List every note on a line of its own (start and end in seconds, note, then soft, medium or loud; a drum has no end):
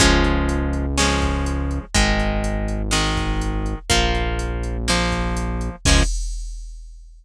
0.00 1.79 C#2 medium
0.00 0.86 F3 loud
0.00 0.86 G#3 loud
0.00 0.86 C#4 loud
0.00 kick loud
0.00 closed hi-hat medium
0.24 closed hi-hat medium
0.49 closed hi-hat medium
0.73 closed hi-hat medium
0.98 1.85 F3 medium
0.98 1.85 G#3 loud
0.98 1.85 C#4 loud
0.98 snare medium
1.22 kick medium
1.22 closed hi-hat medium
1.46 closed hi-hat medium
1.71 closed hi-hat medium
1.95 3.74 G#1 medium
1.95 2.82 D#3 loud
1.95 2.82 G#3 loud
1.95 kick medium
1.95 closed hi-hat medium
2.20 closed hi-hat medium
2.44 closed hi-hat medium
2.68 closed hi-hat medium
2.91 3.79 D#3 loud
2.91 3.79 G#3 medium
2.91 snare medium
3.17 kick medium
3.17 closed hi-hat medium
3.41 closed hi-hat medium
3.66 closed hi-hat medium
3.90 5.70 A#1 medium
3.90 4.77 F3 loud
3.90 4.77 A#3 loud
3.90 kick medium
3.90 closed hi-hat medium
4.15 closed hi-hat medium
4.39 closed hi-hat medium
4.63 closed hi-hat medium
4.88 5.76 F3 loud
4.88 5.76 A#3 medium
4.88 snare medium
5.12 kick medium
5.12 closed hi-hat medium
5.37 closed hi-hat medium
5.61 closed hi-hat medium
5.85 6.03 C#2 loud
5.85 6.03 F3 loud
5.85 6.03 G#3 loud
5.85 6.03 C#4 medium
5.85 kick loud
5.85 crash loud